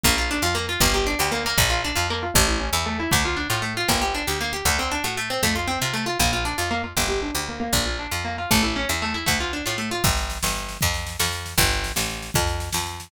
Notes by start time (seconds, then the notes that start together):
0.04 A#1 A#3, kick
0.18 F4
0.31 D4
0.42 F2 F4
0.55 A#3
0.69 F4
0.80 G1 A#3, kick
0.94 G4
1.07 D4
1.19 D2 G4
1.32 A#3
1.46 A#3
1.58 A#1, kick
1.70 F4
1.85 D4
1.96 F2 F4
2.10 A#3
2.23 F4
2.34 A1 A3, kick
2.48 E4
2.60 C#4
2.73 E2 E4
2.86 A3
3.00 E4
3.11 D2 A3, kick
3.25 F4
3.37 D4
3.50 A2 F4
3.62 A3
3.77 F4
3.88 G1 A#3, kick
4.02 G4
4.15 D4
4.27 D2 G4
4.41 A#3
4.53 G4
4.65 D2 A3, kick
4.79 C4
4.91 D4
5.04 A2 F#4
5.17 A3
5.30 C4
5.43 F2 A3, kick
5.56 F4
5.68 C4
5.82 C3 F4
5.94 A3
6.06 F4
6.19 A#1 A#3, kick
6.33 F4
6.45 D4
6.58 F2 F4
6.71 A#3
6.84 F4
6.97 G1 A#3, kick
7.08 G4
7.22 D4
7.35 D2 G4
7.49 A#3
7.60 A#3
7.73 A#1, kick
7.86 F4
7.99 D4
8.11 F2 F4
8.25 A#3
8.38 F4
8.51 A1 A3, kick
8.63 E4
8.76 C#4
8.89 E2 E4
9.02 A3
9.14 E4
9.26 D2 A3, kick
9.40 F4
9.53 D4
9.66 A2 F4
9.78 A3
9.91 F4
10.04 G1, kick, snare
10.17 snare
10.30 snare
10.43 G1, snare
10.55 snare
10.69 snare
10.81 F2, kick, snare
10.94 snare
11.07 snare
11.19 F2, snare
11.32 snare
11.46 snare
11.58 G1, kick, snare
11.71 snare
11.84 snare
11.96 A1, snare
12.10 snare
12.22 snare
12.34 F2, kick, snare
12.47 snare
12.60 snare
12.73 F2, snare
12.87 snare
13.00 snare